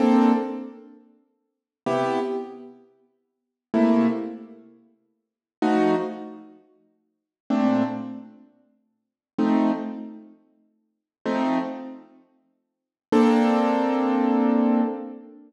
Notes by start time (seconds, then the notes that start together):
0.00 A#3 C4 D4 A4
1.86 C3 B3 E4 G4
3.74 C3 A3 A#3 E4
5.62 F3 A3 D#4 F#4
7.50 A#2 A3 C4 D4
9.38 F3 A3 C4 D#4
11.25 F3 A3 C4 D#4
13.12 A#3 C4 D4 A4